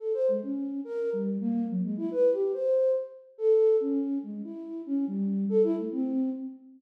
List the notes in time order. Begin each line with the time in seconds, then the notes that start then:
0.00 A4
0.14 C5
0.28 G#3
0.42 C#4
0.84 A#4
1.13 G3
1.41 A#3
1.69 F#3
1.83 G#3
1.97 E4
2.11 B4
2.32 G4
2.54 C5
3.38 A4
3.80 C#4
4.23 G#3
4.44 E4
4.86 C#4
5.07 G3
5.49 A4
5.63 E4
5.77 A3
5.92 C4